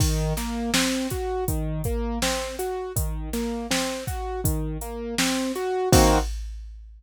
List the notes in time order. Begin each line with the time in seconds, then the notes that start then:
0.00 D#3, kick, crash
0.37 A#3, snare, closed hi-hat
0.74 C4, snare
1.10 F#4, kick, closed hi-hat
1.48 D#3, kick, closed hi-hat
1.84 A#3, kick, closed hi-hat
2.22 C4, snare
2.59 F#4, closed hi-hat
2.96 D#3, kick, closed hi-hat
3.33 A#3, snare, closed hi-hat
3.71 C4, snare
4.07 F#4, kick, closed hi-hat
4.44 D#3, kick, closed hi-hat
4.81 A#3, closed hi-hat
5.18 C4, snare
5.56 F#4, closed hi-hat
5.92 D#3 A#3 C4 F#4, kick, crash